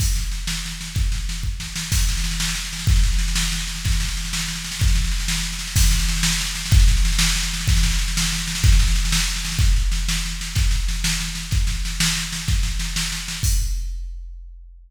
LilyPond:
\new DrumStaff \drummode { \time 6/8 \tempo 4. = 125 <cymc bd sn>8 sn8 sn8 sn8 sn8 sn8 | <bd sn>8 sn8 sn8 bd8 sn8 sn8 | <cymc bd sn>16 sn16 sn16 sn16 sn16 sn16 sn16 sn16 sn16 sn16 sn16 sn16 | <bd sn>16 sn16 sn16 sn16 sn16 sn16 sn16 sn16 sn16 sn16 sn16 sn16 |
<bd sn>16 sn16 sn16 sn16 sn16 sn16 sn16 sn16 sn16 sn16 sn16 sn16 | <bd sn>16 sn16 sn16 sn16 sn16 sn16 sn16 sn16 sn16 sn16 sn16 sn16 | <cymc bd sn>16 sn16 sn16 sn16 sn16 sn16 sn16 sn16 sn16 sn16 sn16 sn16 | <bd sn>16 sn16 sn16 sn16 sn16 sn16 sn16 sn16 sn16 sn16 sn16 sn16 |
<bd sn>16 sn16 sn16 sn16 sn16 sn16 sn16 sn16 sn16 sn16 sn16 sn16 | <bd sn>16 sn16 sn16 sn16 sn16 sn16 sn16 sn16 sn16 sn16 sn16 sn16 | <bd sn>8 sn8 sn8 sn8 sn8 sn8 | <bd sn>8 sn8 sn8 sn8 sn8 sn8 |
<bd sn>8 sn8 sn8 sn8 sn8 sn8 | <bd sn>8 sn8 sn8 sn8 sn8 sn8 | <cymc bd>4. r4. | }